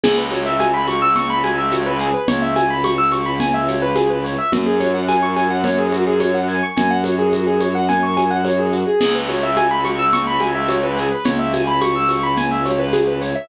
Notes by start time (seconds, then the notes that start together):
0.04 C#2 G#4, crash, low conga, shaker
0.18 B4
0.31 C#5, high conga, shaker
0.46 E5
0.59 G#5, high conga, shaker
0.74 B5
0.87 C#6, high conga, shaker
1.02 E6
1.16 C#6, low conga, shaker
1.30 B5
1.43 G#5, high conga, shaker
1.58 E5
1.71 C#5, high conga, shaker
1.86 B4
1.99 G#4, shaker
2.14 B4
2.28 C#2 C#5, low conga, shaker
2.42 E5
2.56 G#5, high conga, shaker
2.70 B5
2.84 C#6, high conga, shaker
2.98 E6
3.12 C#6, high conga, shaker
3.26 B5
3.40 G#5, low conga, shaker
3.54 E5
3.68 C#5, high conga, shaker
3.82 B4
3.96 G#4, high conga, shaker
4.10 B4
4.24 C#5, shaker
4.38 E5
4.52 F#2 F#4, low conga, shaker
4.66 G#4
4.80 C#5, high conga, shaker
4.94 F#5
5.08 G#5, high conga, shaker
5.23 C#6
5.36 G#5, high conga, shaker
5.50 F#5
5.64 C#5, low conga, shaker
5.79 G#4
5.92 F#4, high conga, shaker
6.07 G#4
6.20 C#5, high conga, shaker
6.34 F#5
6.48 G#5, shaker
6.63 C#6
6.76 F#2 G#5, low conga, shaker
6.91 F#5
7.04 C#5, high conga, shaker
7.19 G#4
7.33 F#4, high conga, shaker
7.47 G#4
7.60 C#5, high conga, shaker
7.75 F#5
7.89 G#5, low conga, shaker
8.03 C#6
8.17 G#5, high conga, shaker
8.31 F#5
8.45 C#5, high conga, shaker
8.59 G#4
8.72 F#4, shaker
8.87 G#4
9.01 C#2 G#4, crash, low conga, shaker
9.15 B4
9.29 C#5, high conga, shaker
9.43 E5
9.57 G#5, high conga, shaker
9.71 B5
9.84 C#6, high conga, shaker
9.99 E6
10.13 C#6, low conga, shaker
10.27 B5
10.40 G#5, high conga, shaker
10.55 E5
10.69 C#5, high conga, shaker
10.83 B4
10.97 G#4, shaker
11.11 B4
11.24 C#2 C#5, low conga, shaker
11.39 E5
11.53 G#5, high conga, shaker
11.67 B5
11.81 C#6, high conga, shaker
11.96 E6
12.09 C#6, high conga, shaker
12.23 B5
12.37 G#5, low conga, shaker
12.51 E5
12.65 C#5, high conga, shaker
12.79 B4
12.93 G#4, high conga, shaker
13.07 B4
13.21 C#5, shaker
13.35 E5